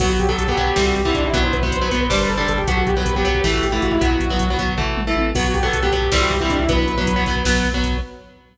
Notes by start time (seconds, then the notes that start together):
0.00 B1 F#3 B3 F#4, kick, crash
0.10 F#4, kick
0.19 B1 G4, kick, closed hi-hat
0.28 F#3 B3 A4, kick
0.38 B1, kick, closed hi-hat
0.48 F#3 B3 G4, kick
0.57 B1 F#3 B3, kick, closed hi-hat
0.67 kick
0.76 C2 E3 G3 C4, kick, snare
0.86 F#4, kick
0.95 C2 G4, kick, closed hi-hat
1.05 E3 G3 C4 E4, kick
1.14 C2 D4, kick, closed hi-hat
1.24 E4, kick
1.33 B1 F#3 B3 F#4, kick, closed hi-hat
1.43 C5, kick
1.53 B1 B4, kick, closed hi-hat
1.62 F#3 B3 C5, kick
1.72 B1, kick, closed hi-hat
1.81 F#3 B3 B4, kick
1.91 B1 F#3 B3, kick, closed hi-hat
2.01 B4, kick
2.10 G1 G3 D4 C5, kick, snare
2.20 B4, kick
2.29 G1 A4, kick, closed hi-hat
2.38 G3 D4 A4, kick
2.48 G1 A4, kick, closed hi-hat
2.58 G4, kick
2.68 B1 F#3 B3 F#4, kick, closed hi-hat
2.77 F#4, kick
2.87 B1 G4, kick, closed hi-hat
2.96 F#3 B3 B4, kick
3.06 B1, kick, closed hi-hat
3.15 F#3 B3 G4, kick
3.25 B1 F#3 B3, kick, closed hi-hat
3.35 kick
3.44 A1 E3 A3, kick, snare
3.54 F#4, kick
3.63 A1 G4, kick, closed hi-hat
3.72 E3 A3 E4, kick
3.82 A1 F#4, kick, closed hi-hat
3.91 E4, kick
4.01 B1 F#3 B3 F#4, kick, closed hi-hat
4.11 kick
4.20 B1, kick, closed hi-hat
4.30 F#3 B3, kick
4.39 B1, kick, closed hi-hat
4.49 F#3 B3, kick
4.58 B1 F#3 B3, kick, closed hi-hat
4.68 kick
4.77 A1 E3 A3, kick, floor tom
4.96 A1, mid tom
5.07 E3 A3
5.16 A1, high tom
5.35 B1 F#3 B3 F#4, kick, crash
5.45 F#4, kick
5.54 B1 G4, kick, closed hi-hat
5.63 F#3 B3 A4, kick
5.73 B1, kick, closed hi-hat
5.83 F#3 B3 G4, kick
5.92 B1 F#3 B3, kick, closed hi-hat
6.02 kick
6.11 C2 E3 G3 C4, kick, snare
6.21 F#4, kick
6.30 C2 G4, kick, closed hi-hat
6.40 E3 G3 C4 E4, kick
6.50 C2 D4, kick, closed hi-hat
6.59 E4, kick
6.68 B1 F#3 B3 B4, kick, closed hi-hat
6.78 kick
6.88 B1, kick, closed hi-hat
6.98 F#3 B3, kick
7.07 B1, kick, closed hi-hat
7.16 F#3 B3, kick
7.26 B1 F#3 B3, kick, closed hi-hat
7.36 kick
7.45 B1 F#3 B3, kick, snare
7.55 kick
7.64 B1, kick, closed hi-hat
7.73 F#3 B3, kick
7.83 B1, kick, closed hi-hat
7.93 kick